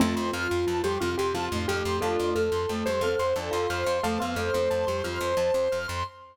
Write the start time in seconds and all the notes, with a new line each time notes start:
0.00 F2 F3 A3 C4 F4 A5
0.16 F2 C6
0.33 F2 F4 F6
0.51 F2 C6
0.67 F2 F3 F4 A5
0.83 F2 G3 G4 C6
1.00 F2 C3 C4 F4 F6
1.18 F2 G4 C6
1.34 F2 C3 C4 F4 A5
1.52 F2 A2 A3 C6
1.68 F2 G4 F6
1.85 F2 C6
2.01 F2 A3 D4 F4 A4 A5
2.18 F2 C6
2.35 F2 A4 F6
2.52 F2 C6
2.69 F2 A3 A4 A5
2.86 F2 G3 G4 C5 C6
3.01 F2 C4 A4 C5 F6
3.19 F2 C5 C6
3.36 F2 D4 A4 D5 A5
3.51 F2 F4 F5 C6
3.70 F2 C5 F6
3.86 F2 C6
4.03 F2 A3 A4 F5 A5
4.18 F2 B3 B4 F5 C6
4.36 F2 A3 A4 C5 F6
4.54 F2 A3 A4 C6
4.70 F2 A5
4.87 F2 G3 G4 C6
5.04 F2 F3 F4 F6
5.21 F2 C6
5.37 F2 A5
5.54 F2 C6
5.72 F2 F6
5.88 F2 C6